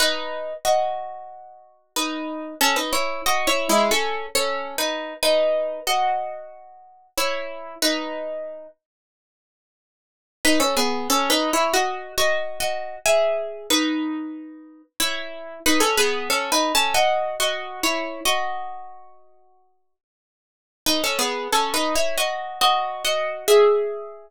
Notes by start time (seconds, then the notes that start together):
0.00 D#4 B4
0.65 F#4 D#5
1.96 D#4 B4
2.61 C#4 A4
2.76 D#4 B4
2.93 E4 C#5
3.26 F#4 D#5
3.47 E4 C#5
3.69 G#3 E4
3.91 C#4 A4
4.35 C#4 A4
4.78 D#4 B4
5.23 D#4 B4
5.87 F#4 D#5
7.18 E4 C#5
7.82 D#4 B4
10.45 D#4 B4
10.60 C#4 A4
10.77 B3 G#4
11.10 C#4 A4
11.30 D#4 B4
11.53 E4 C#5
11.74 F#4 D#5
12.18 F#4 D#5
12.60 F#4 D#5
13.06 G#4 E5
13.70 D#4 B4
15.00 E4 C#5
15.66 D#4 B4
15.80 C#4 A4
15.97 B3 G#4
16.30 C#4 A4
16.52 D#4 B4
16.75 C#4 A4
16.94 F#4 D#5
17.40 F#4 D#5
17.83 E4 C#5
18.25 F#4 D#5
20.86 D#4 B4
21.04 C#4 A4
21.19 B3 G#4
21.52 C#4 A4
21.74 D#4 B4
21.96 E4 C#5
22.18 F#4 D#5
22.61 F#4 D#5
23.05 F#4 D#5
23.48 G#4 E5